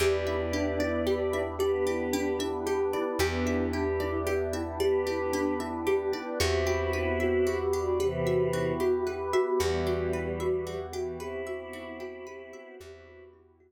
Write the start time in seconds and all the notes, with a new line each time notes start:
0.00 E2 B3 D4 E4 G4 B4 D5
0.26 E4 E5
0.53 D4 G4
0.80 E4 D5
1.07 G4
1.33 E4 E5
1.59 B3 D4 G4 B4 D5
1.87 E4 G4
2.13 D4 G4
2.39 E4 E5
2.66 G4
2.93 E4 D5
3.19 E2 B3 D4 E4 G4 B4
3.45 E4 E5
3.73 D4 G4
4.00 E4 D5
4.26 G4
4.53 E4 E5
4.80 B3 D4 G4 B4 D5
5.06 E4 G4
5.33 D4 G4
5.60 E4 E5
5.87 G4
6.13 E4 D5
6.40 E2 B3 C4 E4 F#4 G4
6.66 F#4 G4
6.93 E4 B4
7.20 F#4 E5
7.46 F#4 G4
7.73 D4 F#4 G4
8.00 C3 E3 B3 E4 G4 B4
8.26 F#4 E5
8.53 E4 F#4
8.80 F#4 G4
9.07 G4 B4
9.33 F#4 E5
9.60 E2 E3 G3 B3 E4 F#4 G4
9.87 F#4 G4
10.13 E4 B4
10.40 F#4 E5
10.67 F#4 G4
10.93 E3 F#4 G4
11.19 C4 E4 G4 B4
11.47 F#4 E5
11.73 E4 F#4
12.00 F#4 G4
12.27 G4 B4
12.53 F#4 E5
12.79 E2 B3 C4 E4 F#4 G4
13.07 F#4
13.33 E4
13.60 B3 E4 F#4 G4 B4